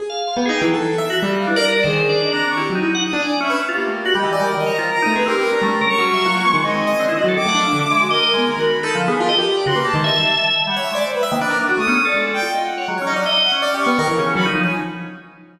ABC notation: X:1
M:5/4
L:1/16
Q:1/4=163
K:none
V:1 name="Drawbar Organ"
z f3 G, ^G2 ^F,2 z3 ^F z3 D d ^A2 | (3c4 d4 D4 E z ^D2 ^f z2 =d2 ^C2 z | F z A, z ^F G, E,2 (3G,2 ^D,2 ^c2 (3=F2 ^A2 ^D2 ^G =C z A | ^C A,2 ^A (3^c2 C2 e2 ^F,2 ^G,6 =C E ^F =A |
(3^D,2 ^f2 =F,2 z2 ^G,2 (3^d4 G,4 ^F4 (3^D2 =F,2 B,2 | G ^d z2 =d ^F ^A,2 ^G, e7 (3=G,2 e2 ^G,2 | z G, z ^D, =D4 A, ^C2 A2 z6 ^c | (3^F,2 ^C2 F,2 ^d3 C4 z ^D, z C2 A ^D2 z |]
V:2 name="Violin"
z6 g z8 f B d2 d | ^G4 ^d ^a2 ^c'2 z4 ^d'2 ^g z e2 z | (3G4 G4 ^d4 (3^A4 ^a4 a4 B A3 | ^a4 ^c'8 ^d8 |
d'8 ^A6 b4 z2 | ^A z4 c'2 =a7 z e (3^f2 e2 d'2 | c B z6 ^d'3 =d3 g2 (3^d2 ^f2 f2 | z2 ^d z3 ^f z3 ^c'4 z2 b z2 ^g |]
V:3 name="Acoustic Grand Piano"
^G z2 F (3B,2 ^D2 E,2 (3A4 e4 =G,4 E ^A =d2 | (3^D,4 =D4 C4 (3G2 ^F,2 E2 z2 D z3 B z | z ^A,3 d G2 d2 z ^d2 C z2 =A, (3C2 G2 B2 | D G, G ^C,2 ^F,3 =F ^A, B, ^D, (3=C2 C2 ^d2 (3=D2 ^D,2 ^F,2 |
z A, D e D, z e ^F2 ^A ^G B, ^D, D,2 z (3=A2 =D,2 G2 | F A G3 ^C, B G (3^D,2 ^d2 G,2 z5 ^c2 =d | z2 e ^A, B ^A A, ^F =A, B, z2 ^G,3 =F3 z2 | ^G, ^c ^D =d e3 =c (3d2 =G2 B,2 ^A E, ^C,2 ^F, D, =F, ^c |]